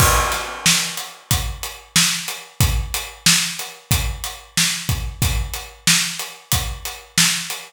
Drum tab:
CC |x-------|--------|--------|
HH |-x-xxx-x|xx-xxx-x|xx-xxx-x|
SD |-oo---o-|--o---o-|--o---o-|
BD |o---o---|o---o--o|o---o---|